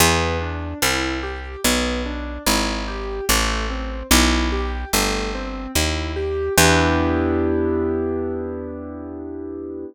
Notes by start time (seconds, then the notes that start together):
0.00 E2 B3
0.41 D4
0.82 C2 E4
1.23 G4
1.64 B1 B3
2.06 D4
2.46 G#1 E4
2.88 G4
3.29 A1 A3
3.70 C4
4.11 B1 E4
4.52 G4
4.93 G1 A3
5.35 C4
5.75 D#2 E4
6.16 G4
6.58 E2 B3 D4 E4 G4